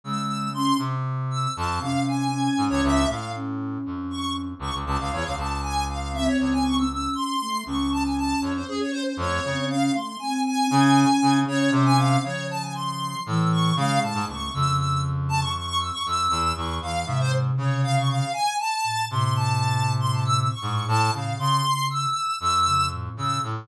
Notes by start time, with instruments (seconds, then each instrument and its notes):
0.04 brass section C#3, flute G#3, lead 1 (square) E6
0.54 flute C#4, lead 1 (square) C6
0.78 brass section C3
1.31 lead 1 (square) E6
1.56 brass section F2, lead 1 (square) A5
1.80 brass section C3, flute C#4, lead 1 (square) F5
2.07 lead 1 (square) G#5
2.32 flute C#4
2.57 brass section G#2
2.69 brass section C#2, lead 1 (square) C#5
2.83 brass section C#2, lead 1 (square) E5
3.07 brass section A2, flute A3, lead 1 (square) F5
3.34 flute C#4
3.86 brass section F2
4.10 lead 1 (square) C#6
4.59 brass section C#2, lead 1 (square) C#6
4.74 brass section C#2
4.86 brass section C#2, lead 1 (square) A5
4.99 brass section C#2, lead 1 (square) F5
5.13 brass section E2, lead 1 (square) C#5
5.24 brass section C#2, lead 1 (square) F5
5.37 brass section C#2, lead 1 (square) A5
5.62 lead 1 (square) G#5
5.89 lead 1 (square) F5
6.13 flute C4, lead 1 (square) E5
6.26 lead 1 (square) C#5
6.38 brass section C#2, lead 1 (square) C#5
6.52 lead 1 (square) G#5
6.64 lead 1 (square) C#6
6.78 lead 1 (square) E6
6.90 flute C#4, lead 1 (square) E6
7.15 lead 1 (square) C6
7.41 flute A3
7.66 brass section C#2, flute C#4, lead 1 (square) C#6
7.92 lead 1 (square) A5
8.05 lead 1 (square) G#5
8.18 lead 1 (square) A5
8.41 brass section F2, lead 1 (square) C#5
8.55 lead 1 (square) C5
8.68 flute C#4, lead 1 (square) G#4
8.80 lead 1 (square) C#5
8.92 lead 1 (square) C5
9.06 lead 1 (square) C5
9.17 brass section F2, flute A3, lead 1 (square) C#5
9.44 brass section C#3, flute C4
9.70 flute C#4, lead 1 (square) F5
9.94 flute A3, lead 1 (square) C6
10.19 flute C4, lead 1 (square) G#5
10.45 lead 1 (square) G#5
10.70 brass section C#3, flute C#4
11.22 brass section C#3
11.47 brass section C#3, flute C#4, lead 1 (square) C#5
11.71 brass section C3, lead 1 (square) C5
11.85 lead 1 (square) G#5
11.97 flute C#4, lead 1 (square) F5
12.23 brass section C#3, flute F3, lead 1 (square) C#5
12.50 lead 1 (square) A5
12.61 lead 1 (square) G#5
12.74 lead 1 (square) C6
13.26 brass section A2, flute E3, lead 1 (square) E6
13.52 lead 1 (square) C#6
13.76 brass section C#3, flute G#3, lead 1 (square) F5
14.02 brass section A2, lead 1 (square) A5
14.14 brass section G#2
14.27 brass section C#2, flute A3, lead 1 (square) C#6
14.53 brass section F2, flute C#3, lead 1 (square) E6
14.78 lead 1 (square) E6
15.29 lead 1 (square) A5
15.40 lead 1 (square) C#6
15.55 lead 1 (square) C#6
15.66 lead 1 (square) C#6
15.80 lead 1 (square) E6
15.92 lead 1 (square) C#6
16.06 brass section F2, lead 1 (square) E6
16.30 brass section E2
16.55 brass section E2, lead 1 (square) C#6
16.81 brass section E2, flute E3, lead 1 (square) F5
17.06 brass section G#2, flute C3, lead 1 (square) E5
17.20 lead 1 (square) C5
17.57 brass section C#3, lead 1 (square) C#5
17.83 lead 1 (square) F5
17.96 lead 1 (square) C#6
18.09 lead 1 (square) F5
18.33 lead 1 (square) G#5
18.59 lead 1 (square) A5
18.84 flute A2
19.10 flute A2, brass section C3, lead 1 (square) C6
19.35 lead 1 (square) A5
20.00 lead 1 (square) C6
20.13 lead 1 (square) A5
20.25 lead 1 (square) E6
20.37 lead 1 (square) E6
20.50 lead 1 (square) C#6
20.62 brass section G#2, flute A2
20.88 brass section A2, lead 1 (square) A5
21.13 brass section C#3, lead 1 (square) F5
21.38 flute C#3, brass section C#3, lead 1 (square) C6
21.90 lead 1 (square) E6
22.40 brass section F2, lead 1 (square) E6
22.66 flute C#3
22.91 flute A2
23.17 brass section C#3, lead 1 (square) E6
23.41 flute A2, brass section A2